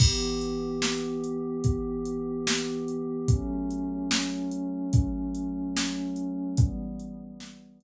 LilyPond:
<<
  \new Staff \with { instrumentName = "Pad 5 (bowed)" } { \time 6/8 \key e \dorian \tempo 4. = 73 <e b g'>2.~ | <e b g'>2. | <fis a cis'>2.~ | <fis a cis'>2. |
<e g b>2. | }
  \new DrumStaff \with { instrumentName = "Drums" } \drummode { \time 6/8 <cymc bd>8. hh8. sn8. hh8. | <hh bd>8. hh8. sn8. hh8. | <hh bd>8. hh8. sn8. hh8. | <hh bd>8. hh8. sn8. hh8. |
<hh bd>8. hh8. sn8. hh8. | }
>>